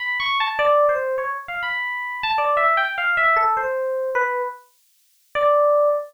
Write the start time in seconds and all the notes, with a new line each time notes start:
0.00 B5
0.20 C#6
0.40 A5
0.59 D5
0.89 C5
1.18 C#5
1.48 F5
1.63 B5
2.23 A5
2.38 D5
2.57 E5
2.77 G5
2.98 F5
3.17 E5
3.36 A4
3.57 C5
4.15 B4
5.35 D5